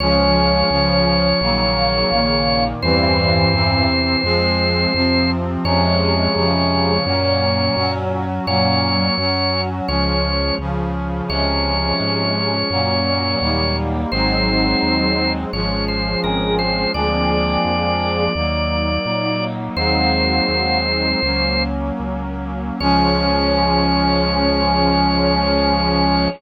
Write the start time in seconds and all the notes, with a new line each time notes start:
0.00 C#2 F3 G#3 C#4 C#5
0.70 C#2 C#3 F3 C#4
1.41 A#1 C#3 D#3 F#3 A#3
2.12 A#1 A#2 D#3 A#3
2.82 E2 G2 E3 G3 C4 C5
3.53 E2 C3 E3 C4
4.23 F2 F3 G#3 C4
4.94 F2 C3 F3 C4
5.64 F2 C3 F3 G#3 C#4 C#5
6.36 F2 C#3 F3 C#4
7.05 F#2 A#2 F#3 A#3 C#4
7.76 F#2 F#3 C#4 F#4
8.46 F#2 A#2 F#3 A#3 C#4 C#5
9.18 F#2 F#3 C#4 F#4
9.88 C#2 F3 G#3 C#4 C#5
10.59 C#2 C#3 F3 C#4
11.28 C#2 C3 F3 G#3 C#4 C#5
12.00 G#2
12.70 F#2 A#2 F#3 A#3 C#4
13.41 D#2 G3 A#3 D#4
14.12 G#1 F#3 G#3 C4 D#4 C5
14.82 D#2
15.52 G#1 F3 G#3 C#4 C#5
15.88 C5
16.23 G#1 C4 G#4 A#4
16.59 C5
16.93 D2 F3 G#3 A#3 C4 D4 G#4 D5
17.65 F2
18.35 D#2 F#3 A#3 D#4
19.06 A#2 F#3 D#4
19.76 D#2 F#3 G#3 A#3 C4 D#4 F#4 C5
20.48 D#2
21.23 C#2 F#3 A#3 C#4
22.00 C#2
22.80 C#2 F3 G#3 C#4 C#5